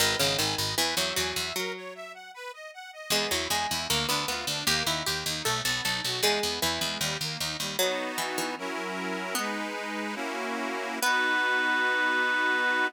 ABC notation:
X:1
M:2/2
L:1/8
Q:1/2=77
K:G#m
V:1 name="Clarinet"
z8 | z8 | z8 | z8 |
z8 | [K:B] z8 | "^rit." z8 | B8 |]
V:2 name="Harpsichord"
D, C, D,2 E, F, F,2 | F,4 z4 | G, F, G,2 A, B, B,2 | =G E G2 =A A A2 |
G,2 E,3 z3 | [K:B] F,2 E, E, z4 | "^rit." B,4 z4 | B,8 |]
V:3 name="Accordion"
B d g d B e g e | A c e f B d f d | B, E G E A, =D ^E D | A, D =G D =A, B, D F |
G, B, E G, =G, A, D G, | [K:B] [B,DF]4 [F,CEA]4 | "^rit." [G,DB]4 [A,CEF]4 | [B,DF]8 |]
V:4 name="Harpsichord" clef=bass
G,,, G,,, G,,, G,,, E,, E,, E,, E,, | z8 | E,, E,, E,, E,, =D,, D,, D,, D,, | D,, D,, D,, D,, B,,, B,,, B,,, B,,, |
E,, E,, E,, E,, D,, D,, D,, D,, | [K:B] z8 | "^rit." z8 | z8 |]